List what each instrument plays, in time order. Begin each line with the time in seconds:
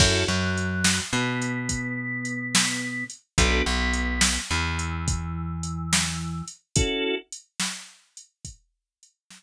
0.00 electric bass (finger) F#2, drawbar organ C#4 E4 F#4 A4, kick, crash
0.28 electric bass (finger) F#2, drawbar organ F#3
0.58 closed hi-hat
0.84 snare
1.13 electric bass (finger) B2, drawbar organ B3
1.42 closed hi-hat
1.69 kick, closed hi-hat
2.25 closed hi-hat
2.55 snare
3.10 closed hi-hat
3.38 electric bass (finger) B1, drawbar organ B3 D4 F#4 A4, kick, closed hi-hat
3.66 electric bass (finger) B1, drawbar organ B3
3.94 closed hi-hat
4.21 snare
4.51 electric bass (finger) E2, drawbar organ E3
4.79 closed hi-hat
5.08 kick, closed hi-hat
5.63 closed hi-hat
5.93 snare
6.48 closed hi-hat
6.76 drawbar organ C#4 E4 F#4 A4, kick, closed hi-hat
7.33 closed hi-hat
7.60 snare
8.17 closed hi-hat
8.45 kick, closed hi-hat
9.03 closed hi-hat
9.31 snare